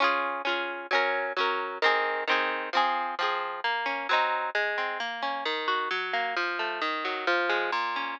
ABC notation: X:1
M:2/4
L:1/8
Q:1/4=132
K:Db
V:1 name="Acoustic Guitar (steel)"
[DFA]2 [DFA]2 | [G,DB]2 [G,DB]2 | [E,CA]2 [E,CA]2 | [F,CA]2 [F,CA]2 |
[K:Bbm] B, D [G,CE]2 | A, C B, D | E, G G, B, | F, =A, E, G, |
F, A, B,, D |]